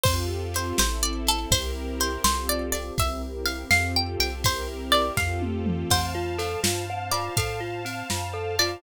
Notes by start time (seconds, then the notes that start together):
0.03 F2 C4 F4 G4 A4 C5, kick, crash
0.54 C5, ride
0.78 A1 C4 E4 A4 C5, snare
1.03 D5
1.27 A4, ride
1.51 C2 C4 E4 G4 A#4 C5, kick, ride
2.00 C5, ride
2.24 C2 C4 F4 G4 A4 C5, snare
2.49 D5
2.72 D5, ride
2.98 C2 C4 E4 G4 A#4 E5, kick, ride
3.46 F5, ride
3.70 F2 C4 F4 G4 A4 F5, snare
3.96 G5
4.19 C2 G5, ride
4.44 C4 E4 G4 A#4 C5, kick, ride
4.92 D5, ride
5.17 F2 C4 F4 G4 A4 F5, kick, snare
5.42 high tom
5.66 mid tom
5.90 F2 C4 C5 F5 A5, kick, crash
6.15 F4
6.38 A4, ride
6.63 G2 F4, snare
6.90 C4
7.11 F4 D5, ride
7.37 A2 A4 F5, kick, ride
7.60 F4
7.85 C4, ride
8.10 F#2 F4, snare
8.33 A4
8.59 F4 D5, ride